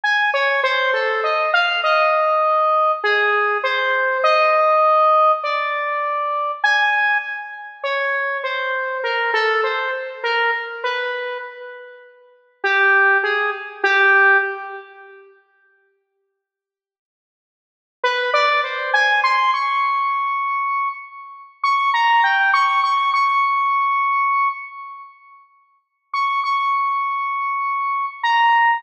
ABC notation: X:1
M:6/8
L:1/16
Q:3/8=33
K:none
V:1 name="Lead 1 (square)"
^g ^c =c A ^d f d4 ^G2 | c2 ^d4 =d4 ^g2 | z2 ^c2 =c2 ^A =A c z ^A z | B2 z4 G2 ^G z =G2 |
z12 | B d c ^g c' ^c'5 z2 | ^c' ^a g c' c' c'5 z2 | z3 ^c' c'6 ^a2 |]